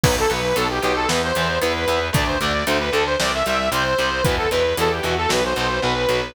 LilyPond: <<
  \new Staff \with { instrumentName = "Lead 2 (sawtooth)" } { \time 4/4 \key b \phrygian \tempo 4 = 114 b'16 a'16 b'8 a'16 g'16 g'16 a'16 b'16 c''16 c''8 b'4 | d''16 c''16 d''8 c''16 b'16 a'16 c''16 d''16 e''16 e''8 c''4 | b'16 a'16 b'8 a'16 g'16 fis'16 a'16 b'16 c''16 c''8 b'4 | }
  \new Staff \with { instrumentName = "Overdriven Guitar" } { \time 4/4 \key b \phrygian <fis b>8 <fis b>8 <fis b>8 <fis b>8 <e b>8 <e b>8 <e b>8 <e b>8 | <d a>8 <d a>8 <d a>8 <d a>8 <c g>8 <c g>8 <c g>8 <c g>8 | <b, e>8 <b, e>8 <b, e>8 <b, e>8 <b, fis>8 <b, fis>8 <b, fis>8 <b, fis>8 | }
  \new Staff \with { instrumentName = "Electric Bass (finger)" } { \clef bass \time 4/4 \key b \phrygian b,,8 b,,8 b,,8 b,,8 e,8 e,8 e,8 e,8 | d,8 d,8 d,8 d,8 c,8 c,8 c,8 c,8 | e,8 e,8 e,8 e,8 b,,8 b,,8 b,,8 b,,8 | }
  \new DrumStaff \with { instrumentName = "Drums" } \drummode { \time 4/4 <cymc bd>8 hh8 hh8 hh8 sn8 hh8 hh8 hh8 | <hh bd>8 hh8 hh8 hh8 sn8 hh8 hh8 hh8 | <hh bd>8 hh8 hh8 hh8 sn8 hh8 r8 hh8 | }
>>